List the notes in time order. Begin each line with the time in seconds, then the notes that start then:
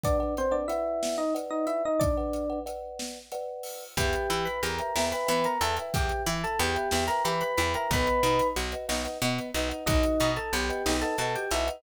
0.04 D4 B4 D5 F#5, kick, closed hi-hat
0.20 B4 D5 F#5
0.37 C4 C5, closed hi-hat
0.51 D4 B4 D5 F#5
0.68 E4 B4 D5 E5 F#5, closed hi-hat
1.03 snare
1.18 D#4 D#5
1.35 B4 D5 F#5, closed hi-hat
1.51 D#4 D#5
1.67 E4 E5, closed hi-hat
1.85 D#4 D#5
2.00 D4 D5, kick, closed hi-hat
2.17 B4 D5 F#5
2.33 closed hi-hat
2.50 B4 D5 F#5
2.66 B4 D5 F#5, closed hi-hat
2.99 snare
3.32 B4 D5 F#5, closed hi-hat
3.63 open hi-hat
3.97 E2 B3 G4 B4 E5 G5, kick, closed hi-hat
4.13 closed hi-hat
4.30 E3 E4, closed hi-hat
4.45 B4 B5, closed hi-hat
4.63 E2 G4 A#4 A#5, closed hi-hat
4.79 B4 E5 G5, closed hi-hat
4.96 E2 E4 B4 E5 G5, snare
5.12 B4 E5 G5 B5, closed hi-hat
5.27 E3 B3 B4 E5 G5 B5, closed hi-hat
5.44 A#4 A#5, closed hi-hat
5.61 E2 E4 A4 B4 E5 G5 A5, closed hi-hat
5.77 B4 E5 G5, closed hi-hat
5.94 E2 G4 G5, kick, closed hi-hat
6.09 closed hi-hat
6.26 E3 E4 E5, closed hi-hat
6.44 A4 A5, closed hi-hat
6.59 E2 B3 G4 G5, closed hi-hat
6.75 B4 E5 G5, closed hi-hat
6.91 E2 E4 B4 E5 G5, snare
7.08 A#4 B4 E5 G5 A#5, closed hi-hat
7.25 E3 G4 B4 E5 G5 B5, closed hi-hat
7.41 B4 B5, closed hi-hat
7.58 E2 E4 B4 E5 G5 B5, closed hi-hat
7.74 A#4 B4 E5 G5 A#5, closed hi-hat
7.91 B1 B3 B4 D#5 F#5 B5, kick, closed hi-hat
8.07 closed hi-hat
8.23 B2 D#4, closed hi-hat
8.39 closed hi-hat
8.56 B1 F#4, closed hi-hat
8.72 B4 D#5 F#5, closed hi-hat
8.89 B1 D#4 B4 D#5 F#5, snare
9.05 B4 D#5 F#5, closed hi-hat
9.22 B2 B3 B4 D#5 F#5, closed hi-hat
9.39 closed hi-hat
9.54 B1 D#4 B4 D#5 F#5, closed hi-hat
9.69 B4 D#5 F#5, closed hi-hat
9.86 B1 D#4 F#4 D#5, kick, closed hi-hat
10.03 closed hi-hat
10.20 B2 D#4, closed hi-hat
10.36 A4 A5, closed hi-hat
10.53 B1 B3 G4 G5, closed hi-hat
10.69 B4 D#5 F#5, closed hi-hat
10.86 B1 D#4 B4 D#5 F#5, snare
11.02 A4 B4 D#5 F#5 A5, closed hi-hat
11.18 B2 F#4 A4 B4 D#5 F#5 A5, closed hi-hat
11.36 G4 G5, closed hi-hat
11.51 B1 D#4 E4 B4 D#5 E5 F#5, closed hi-hat
11.67 B4 D#5 F#5, closed hi-hat